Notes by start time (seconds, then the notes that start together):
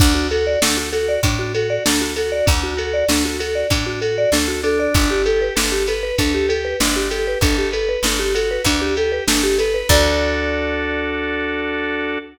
0.00 D2 D4, kick, crash
0.15 F#4
0.31 F#4 A4, ride
0.47 D5
0.61 D2 D4 A4, snare
0.77 F#4
0.93 F#4 A4, ride
1.09 D5
1.23 A2 D4, kick, ride
1.39 F#4
1.55 F#4 A4, ride
1.70 D5
1.85 D2 D4 A4, snare
2.01 F#4
2.16 F#4 A4, ride
2.32 D5
2.46 D2 D4, kick, ride
2.63 F#4
2.77 F#4 A4, ride
2.94 D5
3.09 D2 D4 A4, snare
3.25 F#4
3.39 F#4 A4, ride
3.55 D5
3.70 A2 D4, kick, ride
3.86 F#4
4.01 F#4 A4, ride
4.18 D5
4.32 D2 D4 A4, snare
4.48 F#4
4.63 D4 A4, ride
4.79 D5
4.94 G1 D4, kick, ride
5.11 G4
5.26 G4 A4, ride
5.41 B4
5.55 G1 D4 A4, snare
5.72 G4
5.87 A4 B4, ride
6.03 B4
6.18 D2 D4 A4, kick, ride
6.34 G4
6.49 G4 A4, ride
6.65 B4
6.80 G1 D4, snare
6.96 G4
7.10 G4 A4, ride
7.27 B4
7.41 G1 D4 A4, kick, ride
7.58 G4
7.72 A4 B4, ride
7.89 B4
8.03 G1 D4 A4, snare
8.19 G4
8.34 F#4 A4, ride
8.51 B4
8.64 D2 D4, kick, ride
8.82 G4
8.97 G4 A4, ride
9.12 B4
9.27 G1 D4 A4, snare
9.43 G4
9.58 A4 B4, ride
9.74 B4
9.89 D2 D4 F#4 A4 D5, kick, crash